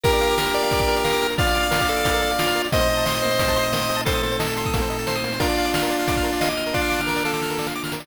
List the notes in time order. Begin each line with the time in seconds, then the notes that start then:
0.04 A#3 D4 F4 G4 A#4, kick, closed hi-hat
0.13 D5, closed hi-hat
0.21 F5, closed hi-hat
0.30 D6, closed hi-hat
0.38 A#4 F6, snare
0.46 A#4, closed hi-hat
0.54 D5, closed hi-hat
0.63 F5, closed hi-hat
0.71 D6, kick, closed hi-hat
0.79 F6, kick, closed hi-hat
0.88 A#4, closed hi-hat
0.96 D5, closed hi-hat
1.04 A#4 F5, snare
1.13 D6, closed hi-hat
1.22 F6, closed hi-hat
1.30 A#4, closed hi-hat
1.38 F4 D5 F5, kick, closed hi-hat
1.47 F5, closed hi-hat
1.54 D6, closed hi-hat
1.63 F6, closed hi-hat
1.71 F4 A#4, snare
1.80 D5, kick, closed hi-hat
1.88 A4 F5, closed hi-hat
1.97 D6, closed hi-hat
2.04 F6, kick, closed hi-hat
2.14 A#4, closed hi-hat
2.22 D5, closed hi-hat
2.31 F5, closed hi-hat
2.39 F4 D6, snare
2.47 F6, closed hi-hat
2.55 A#4, closed hi-hat
2.64 D5, closed hi-hat
2.72 A#2 A3 A#3 C4 D#4 C5 D#5, kick, closed hi-hat
2.81 C5, closed hi-hat
2.89 D#5, closed hi-hat
2.97 A5, closed hi-hat
3.06 D#5 C6, snare
3.14 D#6, closed hi-hat
3.22 A#3 C5, closed hi-hat
3.31 C5, closed hi-hat
3.39 D#5, kick, closed hi-hat
3.48 A5, kick, closed hi-hat
3.56 C6, closed hi-hat
3.63 D#6, closed hi-hat
3.72 A#3 D#5, snare
3.81 C5, closed hi-hat
3.89 D#5, closed hi-hat
3.97 A5, closed hi-hat
4.05 A4 C5 C6, kick, closed hi-hat
4.14 D#6, closed hi-hat
4.23 A#3 C5, closed hi-hat
4.32 C5, closed hi-hat
4.39 A4 D#5, snare
4.47 A5, closed hi-hat
4.57 C6, closed hi-hat
4.65 D#6, kick, closed hi-hat
4.74 A#3, kick, closed hi-hat
4.82 C5, closed hi-hat
4.90 D#5, closed hi-hat
4.99 A5, closed hi-hat
5.07 C5 C6, snare
5.15 D#6, closed hi-hat
5.24 A#3, closed hi-hat
5.32 C5, closed hi-hat
5.40 A#3 D4 F4 A#4 D5, kick, closed hi-hat
5.48 D5, closed hi-hat
5.57 F5, closed hi-hat
5.65 D6, closed hi-hat
5.74 F6, snare
5.83 A#4, closed hi-hat
5.90 D5, closed hi-hat
5.99 F5, closed hi-hat
6.08 D6, kick, closed hi-hat
6.16 F6, kick, closed hi-hat
6.23 A#4, closed hi-hat
6.33 D5, closed hi-hat
6.41 D#5 F5, snare
6.49 D6, closed hi-hat
6.57 F6, closed hi-hat
6.66 A#4, closed hi-hat
6.74 D4 F4 D5, kick, snare
6.81 F5
6.90 D6, snare
7.00 F6, snare
7.07 A#4, snare
7.16 D5, snare
7.25 A4 F5, snare
7.33 D6, snare
7.42 F6, snare
7.50 A#4, snare
7.59 D5, snare
7.67 F5, snare
7.75 D6
7.84 F6, snare
7.92 A#4, snare
8.00 D5, snare